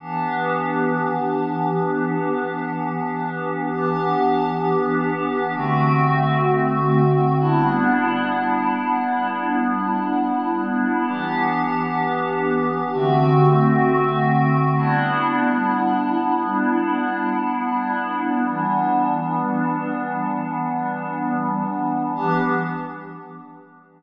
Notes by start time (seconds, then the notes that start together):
0.00 E3 B3 D4 G4
3.70 E3 B3 D4 G4
5.54 D3 A3 C4 F#4
7.38 G3 B3 D4 E4
11.08 E3 B3 D4 G4
12.93 D3 A3 C4 F#4
14.76 G3 B3 D4 E4
18.46 E3 G3 B3 D4
22.15 E3 B3 D4 G4